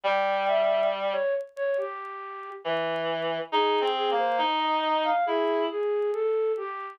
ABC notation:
X:1
M:4/4
L:1/16
Q:1/4=69
K:Fm
V:1 name="Flute"
g2 _f2 z ^c z c G4 z4 | A2 A c z e e f ^G2 G2 =A2 =G2 |]
V:2 name="Clarinet"
G,6 z6 _F,4 | (3E2 C2 B,2 E4 =E2 z6 |]